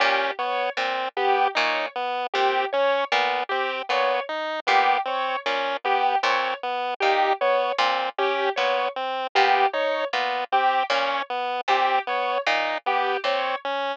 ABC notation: X:1
M:3/4
L:1/8
Q:1/4=77
K:none
V:1 name="Harpsichord" clef=bass
_B,, z B,, z B,, z | _B,, z B,, z B,, z | _B,, z B,, z B,, z | _B,, z B,, z B,, z |
_B,, z B,, z B,, z | _B,, z B,, z B,, z |]
V:2 name="Lead 1 (square)"
_D B, C B, _E B, | C _D B, C B, _E | B, C _D B, C B, | _E B, C _D B, C |
B, _E B, C _D B, | C B, _E B, C _D |]
V:3 name="Acoustic Grand Piano"
G _d z G d z | G _d z G d z | G _d z G d z | G _d z G d z |
G _d z G d z | G _d z G d z |]